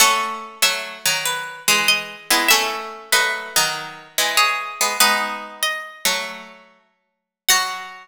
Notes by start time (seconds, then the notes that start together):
0.00 A3 C#4 A4 F#5
0.62 F#3 A3 E5
1.05 D#3 F#3
1.25 B4
1.68 E3 G#3 G#4
1.88 D#5
2.30 G#3 B3 E4
2.48 A3 C#4 A4 E5
3.12 F#3 A3 B4 D#5
3.56 D#3 F#3
4.18 E3 G#3
4.37 G#4 C#5
4.81 G#3 B3
5.00 G#3 B3 D#4 B4
5.63 D#5
6.05 F#3 A3
7.49 F#3 F#4 F#5